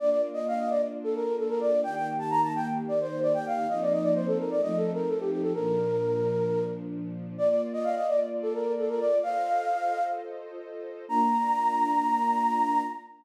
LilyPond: <<
  \new Staff \with { instrumentName = "Flute" } { \time 4/4 \key bes \major \tempo 4 = 130 d''16 d''16 r16 ees''16 f''16 ees''16 d''16 r8 a'16 bes'8 a'16 bes'16 d''8 | g''16 g''16 r16 a''16 bes''16 a''16 g''16 r8 d''16 c''8 d''16 g''16 f''8 | ees''16 d''16 ees''16 d''16 c''16 a'16 bes'16 d''16 \tuplet 3/2 { ees''8 a'8 bes'8 } a'16 g'16 g'16 a'16 | bes'2~ bes'8 r4. |
d''16 d''16 r16 ees''16 f''16 ees''16 d''16 r8 a'16 bes'8 a'16 bes'16 d''8 | f''2 r2 | bes''1 | }
  \new Staff \with { instrumentName = "String Ensemble 1" } { \time 4/4 \key bes \major <bes d' f'>1 | <ees bes g'>1 | <f bes c' ees'>2 <f a c' ees'>2 | <bes, f d'>1 |
<bes f' d''>1 | <f' a' c'' ees''>1 | <bes d' f'>1 | }
>>